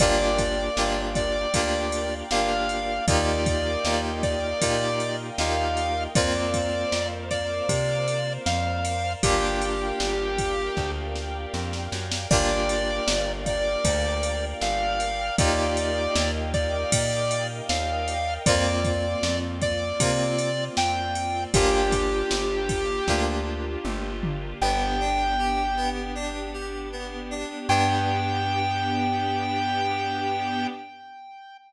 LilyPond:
<<
  \new Staff \with { instrumentName = "Lead 1 (square)" } { \time 4/4 \key g \minor \tempo 4 = 78 d''4. d''4. f''4 | d''4. d''4. f''4 | d''4. d''4. f''4 | g'2~ g'8 r4. |
d''4. d''4. f''4 | d''4. d''4. f''4 | d''4. d''4. g''4 | g'2~ g'8 r4. |
\key g \major g''2 r2 | g''1 | }
  \new Staff \with { instrumentName = "Electric Piano 2" } { \time 4/4 \key g \minor <bes d' f' g'>4 <bes d' f' g'>4 <bes d' f' g'>4 <bes d' f' g'>4 | <bes ees' f' g'>4 <bes ees' f' g'>4 <bes ees' f' g'>4 <bes ees' f' g'>4 | <bes c' f'>1 | <bes d' f' g'>1 |
<bes d' f' g'>1 | <bes ees' f' g'>1 | <bes c' f'>2 <bes c' f'>2 | <bes d' f' g'>2 <bes d' f' g'>2 |
\key g \major b8 d'8 g'8 b8 d'8 g'8 b8 d'8 | <b d' g'>1 | }
  \new Staff \with { instrumentName = "Electric Bass (finger)" } { \clef bass \time 4/4 \key g \minor g,,4 g,,4 d,4 g,,4 | ees,4 ees,4 bes,4 ees,4 | f,4 f,4 c4 f,4 | g,,4 g,,4 d,4 f,8 fis,8 |
g,,4 g,,4 d,4 g,,4 | ees,4 ees,4 bes,4 ees,4 | f,4 f,4 c4 f,4 | g,,4 g,,4 d,4 g,,4 |
\key g \major g,,1 | g,1 | }
  \new Staff \with { instrumentName = "Pad 5 (bowed)" } { \time 4/4 \key g \minor <bes' d'' f'' g''>1 | <bes' ees'' f'' g''>1 | <bes' c'' f''>1 | <bes' d'' f'' g''>1 |
<bes' d'' f'' g''>1 | <bes' ees'' f'' g''>1 | <bes c' f'>1 | <bes d' f' g'>1 |
\key g \major <b d' g'>1 | <b d' g'>1 | }
  \new DrumStaff \with { instrumentName = "Drums" } \drummode { \time 4/4 <bd cymr>8 <bd cymr>8 sn8 <bd cymr>8 <bd cymr>8 cymr8 sn8 cymr8 | <bd cymr>8 <bd cymr>8 sn8 <bd cymr>8 <bd cymr>8 cymr8 sn8 cymr8 | <bd cymr>8 <bd cymr>8 sn8 <bd cymr>8 <bd cymr>8 cymr8 sn8 cymr8 | <bd cymr>8 cymr8 sn8 <bd cymr>8 <bd sn>8 sn8 sn16 sn16 sn16 sn16 |
<cymc bd>8 cymr8 sn8 <bd cymr>8 <bd cymr>8 cymr8 sn8 cymr8 | <bd cymr>8 cymr8 sn8 <bd cymr>8 <bd cymr>8 cymr8 sn8 cymr8 | <bd cymr>8 <bd cymr>8 sn8 <bd cymr>8 <bd cymr>8 cymr8 sn8 cymr8 | <bd cymr>8 <bd cymr>8 sn8 <bd cymr>8 <bd sn>4 toml8 tomfh8 |
r4 r4 r4 r4 | r4 r4 r4 r4 | }
>>